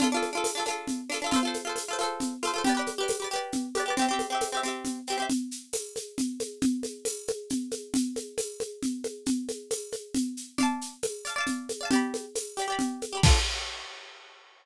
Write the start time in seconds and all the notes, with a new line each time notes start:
0.00 D4 F4 A4, low conga, shaker
0.12 D4 F4
0.17 A4
0.22 high conga, shaker
0.33 D4 F4
0.37 A4
0.44 tambourine, high conga, shaker
0.55 D4 F4
0.60 A4
0.66 D4 F4, high conga, shaker
0.70 A4
0.87 low conga, shaker
1.09 D4 F4, shaker
1.14 A4
1.22 D4 F4
1.26 A4
1.31 F4 A4, low conga, shaker
1.36 C5
1.43 F4 A4
1.47 C5
1.54 high conga, shaker
1.65 F4 A4
1.69 C5
1.76 tambourine, high conga, shaker
1.88 F4 A4
1.93 C5
1.99 F4 A4, high conga, shaker
2.03 C5
2.20 low conga, shaker
2.43 F4 A4, high conga, shaker
2.47 C5
2.54 F4 A4
2.58 C5
2.64 G4 B4, low conga, shaker
2.69 D5
2.75 G4 B4
2.79 D5
2.86 high conga, shaker
2.98 G4 B4
3.03 D5
3.08 tambourine, high conga, shaker
3.20 G4 B4
3.24 D5
3.31 G4 B4, shaker
3.36 D5
3.52 low conga, shaker
3.75 G4 B4, high conga, shaker
3.80 D5
3.86 G4 B4
3.90 D5
3.97 C4 G4, low conga, shaker
4.02 E5
4.09 C4 G4
4.13 E5
4.19 high conga, shaker
4.30 C4 G4
4.35 E5
4.41 tambourine, high conga, shaker
4.52 C4 G4
4.57 E5
4.63 C4 G4, shaker
4.68 E5
4.85 low conga, shaker
5.07 C4 G4, shaker
5.12 E5
5.18 C4 G4
5.22 E5
5.30 low conga, shaker
5.51 shaker
5.73 tambourine, high conga, shaker
5.96 high conga, shaker
6.18 low conga, shaker
6.40 high conga, shaker
6.62 low conga, shaker
6.83 high conga, shaker
7.05 tambourine, high conga, shaker
7.27 high conga, shaker
7.50 low conga, shaker
7.71 high conga, shaker
7.94 low conga, shaker
8.16 high conga, shaker
8.38 tambourine, high conga, shaker
8.60 high conga, shaker
8.83 low conga, shaker
9.04 high conga, shaker
9.26 low conga, shaker
9.48 high conga, shaker
9.70 tambourine, high conga, shaker
9.92 high conga, shaker
10.15 low conga, shaker
10.37 shaker
10.58 D5 F5, low conga, shaker
10.63 A5
10.81 shaker
11.03 tambourine, high conga, shaker
11.25 D5 F5, shaker
11.30 A5
11.36 D5 F5
11.41 A5
11.46 low conga, shaker
11.69 high conga, shaker
11.81 D5 F5
11.85 A5
11.91 G4 D5, low conga, shaker
11.95 B5
12.14 high conga, shaker
12.35 tambourine, high conga, shaker
12.57 G4 D5, shaker
12.62 B5
12.68 G4 D5
12.72 B5
12.79 low conga, shaker
13.02 high conga, shaker
13.13 G4 D5
13.17 B5
13.23 D4 F4, kick, crash
13.28 A4